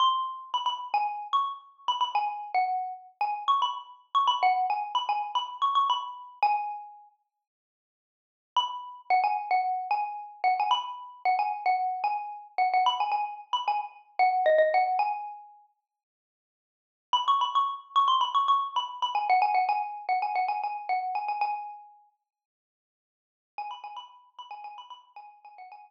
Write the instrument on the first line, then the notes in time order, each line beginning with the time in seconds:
xylophone
0.00 C6
0.54 B5
0.66 B5
0.94 G#5
1.33 C#6
1.88 B5
2.01 B5
2.15 G#5
2.54 F#5
3.21 G#5
3.48 C#6
3.62 B5
4.15 C#6
4.27 B5
4.43 F#5
4.70 G#5
4.95 B5
5.09 G#5
5.35 B5
5.62 C#6
5.75 C#6
5.90 B5
6.43 G#5
8.56 B5
9.10 F#5
9.24 G#5
9.51 F#5
9.91 G#5
10.44 F#5
10.60 G#5
10.71 B5
11.25 F#5
11.39 G#5
11.66 F#5
12.04 G#5
12.58 F#5
12.74 F#5
12.86 B5
13.00 G#5
13.12 G#5
13.53 B5
13.68 G#5
14.19 F#5
14.46 D#5
14.58 D#5
14.74 F#5
14.99 G#5
17.13 B5
17.28 C#6
17.41 B5
17.55 C#6
17.96 C#6
18.08 C6
18.21 B5
18.35 C#6
18.48 C#6
18.76 B5
19.02 B5
19.15 G#5
19.30 F#5
19.42 G#5
19.54 F#5
19.69 G#5
20.09 F#5
20.22 G#5
20.35 F#5
20.48 G#5
20.64 G#5
20.89 F#5
21.15 G#5
21.28 G#5
21.41 G#5
23.58 G#5
23.71 B5
23.84 G#5
23.97 B5
24.39 B5
24.51 G#5
24.64 G#5
24.78 B5
24.90 B5
25.16 G#5
25.45 G#5
25.58 F#5
25.72 G#5